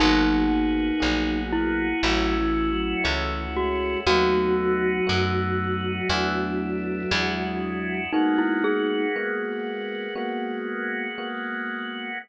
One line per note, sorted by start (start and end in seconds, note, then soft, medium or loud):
0.00 0.92 G#1 loud
0.00 0.46 F#3 loud
0.00 0.90 A#3 loud
0.00 2.02 A#3 medium
0.00 0.90 B3 medium
0.00 2.02 B3 medium
0.00 1.40 D#4 loud
0.00 0.90 F#4 loud
0.00 2.02 F#4 medium
0.00 0.90 G#4 medium
0.00 2.02 G#4 medium
1.00 1.94 A#1 medium
1.00 1.88 F#3 medium
1.00 1.92 A#3 medium
1.00 1.92 B3 medium
1.00 1.92 F#4 medium
1.00 1.92 G#4 medium
1.53 3.50 E4 loud
2.03 2.94 A1 loud
2.03 2.36 F#3 loud
2.03 2.95 A3 loud
2.03 4.05 A3 medium
2.03 2.95 C#4 loud
2.03 4.05 C#4 medium
2.03 2.95 E4 loud
2.03 4.05 E4 medium
2.03 2.95 F#4 loud
2.03 4.05 F#4 loud
2.38 2.71 E3 loud
2.71 3.03 F#3 loud
3.04 3.96 C#2 medium
3.04 3.46 E3 loud
3.04 3.95 A3 medium
3.04 3.95 C#4 loud
3.04 3.95 E4 medium
3.04 3.95 F#4 medium
3.55 4.00 G#3 loud
3.55 3.99 F#4 medium
4.07 4.98 D#2 loud
4.07 7.99 F#3 loud
4.07 6.08 A3 medium
4.07 5.00 A3 loud
4.07 6.08 B3 medium
4.07 5.00 B3 loud
4.07 6.08 D#4 medium
4.07 5.00 D#4 medium
4.07 6.08 F#4 medium
4.07 7.96 F#4 loud
4.07 5.00 F#4 loud
5.07 6.01 F#2 medium
5.07 5.98 A3 medium
5.07 5.98 B3 medium
5.07 5.98 D#4 medium
5.07 5.98 F#4 loud
6.10 7.03 E2 medium
6.10 7.01 A3 loud
6.10 7.11 A3 medium
6.10 7.01 B3 loud
6.10 7.11 B3 medium
6.10 7.01 D4 loud
6.10 7.10 D4 medium
6.10 7.01 E4 loud
6.10 7.10 E4 medium
7.11 8.05 E2 loud
7.11 8.11 G#3 medium
7.11 8.03 G#3 loud
7.11 8.11 D4 medium
7.11 8.03 D4 medium
7.11 8.11 E4 medium
7.11 8.03 E4 loud
7.11 8.11 F#4 medium
7.11 8.03 F#4 medium
8.12 10.14 G#3 medium
8.12 9.05 G#3 loud
8.12 10.14 A#3 medium
8.12 9.05 A#3 loud
8.12 10.14 B3 medium
8.12 9.05 B3 medium
8.12 8.37 D#4 medium
8.12 9.10 D#4 loud
8.12 10.14 F#4 medium
8.12 9.05 F#4 loud
8.38 8.62 E4 medium
8.64 11.28 G#4 medium
9.16 10.07 G#3 medium
9.16 10.07 A#3 medium
9.16 10.07 B3 medium
9.16 10.07 F#4 medium
10.15 11.07 G#3 medium
10.15 12.19 G#3 medium
10.15 11.07 A#3 medium
10.15 12.19 A#3 medium
10.15 11.07 B3 loud
10.15 12.19 B3 medium
10.15 11.07 F#4 loud
10.15 12.19 F#4 medium
11.18 12.10 G#3 medium
11.18 12.10 A#3 medium
11.18 12.10 B3 medium
11.18 12.10 F#4 medium